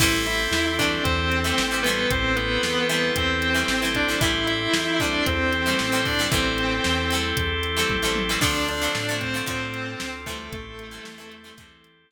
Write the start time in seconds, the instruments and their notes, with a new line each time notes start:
0.00 synth bass 1 A1, acoustic guitar (steel) E3 G3 A3 C4, drawbar organ C4 E4 G4 A4, distortion guitar E4 E5, kick, crash
0.26 distortion guitar E4 E5, closed hi-hat
0.51 synth bass 1 E2, snare
0.79 acoustic guitar (steel) E3 G3 A3 C4, distortion guitar D4 D5, kick, closed hi-hat
1.04 synth bass 1 E2, distortion guitar C4 C5, kick, closed hi-hat
1.32 closed hi-hat
1.44 acoustic guitar (steel) E3 G3 A3 C4
1.58 synth bass 1 A1, snare
1.71 acoustic guitar (steel) E3 G3 A3 C4
1.83 acoustic guitar (steel) E3 G3, distortion guitar B3 B4, closed hi-hat
1.88 acoustic guitar (steel) A3 C4
2.10 synth bass 1 A1, drawbar organ C4 E4 G4 A4, distortion guitar C4 C5, kick, closed hi-hat
2.36 distortion guitar B3 B4, closed hi-hat
2.63 synth bass 1 E2, snare
2.89 acoustic guitar (steel) E3 G3 A3 C4, distortion guitar B3 B4, closed hi-hat
3.16 synth bass 1 E2, distortion guitar C4 C5, kick, closed hi-hat
3.42 closed hi-hat
3.54 acoustic guitar (steel) E3 G3 A3 C4
3.68 synth bass 1 A1, snare
3.82 acoustic guitar (steel) E3 G3 A3 C4
3.95 distortion guitar D4 D5, kick, closed hi-hat
4.08 acoustic guitar (steel) E3 G3 A3 C4
4.21 synth bass 1 A1, acoustic guitar (steel) E3 G3 A3 C4, drawbar organ C4 E4 G4 A4, distortion guitar E4 E5, kick, closed hi-hat
4.47 distortion guitar E4 E5, closed hi-hat
4.74 synth bass 1 E2, snare
5.00 acoustic guitar (steel) E3 G3 A3 C4, distortion guitar D4 D5, kick, closed hi-hat
5.26 synth bass 1 E2, distortion guitar C4 C5, kick, closed hi-hat
5.53 closed hi-hat
5.66 acoustic guitar (steel) E3 G3 A3 C4
5.79 synth bass 1 A1, snare
5.92 acoustic guitar (steel) E3 G3 A3 C4
6.05 distortion guitar D4 D5, kick, open hi-hat
6.19 acoustic guitar (steel) E3 G3 A3 C4
6.30 synth bass 1 A1, acoustic guitar (steel) E3 G3 A3, distortion guitar C4 C5, drawbar organ C4 E4 G4 A4, kick, closed hi-hat
6.35 acoustic guitar (steel) C4
6.58 closed hi-hat
6.84 synth bass 1 E2, snare
7.11 acoustic guitar (steel) E3 G3 A3, closed hi-hat
7.15 acoustic guitar (steel) C4
7.37 synth bass 1 E2, kick, closed hi-hat
7.63 closed hi-hat
7.77 acoustic guitar (steel) E3 G3 A3 C4
7.90 synth bass 1 A1, kick, high tom
8.02 acoustic guitar (steel) E3 G3 A3 C4
8.16 high tom
8.29 acoustic guitar (steel) E3 G3 A3 C4
8.41 synth bass 1 D2, acoustic guitar (steel) D3 F3 A3 C4, drawbar organ C4 D4 F4 A4, distortion guitar D4 D5, kick, crash
8.68 distortion guitar D4 D5, closed hi-hat
8.81 acoustic guitar (steel) D3 F3 A3 C4
8.95 synth bass 1 A2, snare
9.09 acoustic guitar (steel) D3 F3 A3 C4
9.21 distortion guitar C4 C5, kick, closed hi-hat
9.34 acoustic guitar (steel) D3 F3 A3 C4
9.46 synth bass 1 A2, acoustic guitar (steel) D3 F3 A3 C4, distortion guitar C4 C5, kick, closed hi-hat
9.74 closed hi-hat
10.00 synth bass 1 D2, snare
10.26 acoustic guitar (steel) E3 G3 A3 C4, distortion guitar A3 A4, kick, closed hi-hat
10.52 synth bass 1 A1, distortion guitar A3 A4, drawbar organ C4 E4 G4 A4, kick, closed hi-hat
10.79 closed hi-hat
10.91 acoustic guitar (steel) E3 G3 A3 C4
11.05 synth bass 1 E2, snare
11.18 acoustic guitar (steel) E3 G3 A3 C4
11.32 closed hi-hat
11.44 acoustic guitar (steel) E3 G3 A3 C4
11.57 synth bass 1 E2, acoustic guitar (steel) E3 G3 A3 C4, kick, closed hi-hat
11.84 closed hi-hat
12.11 snare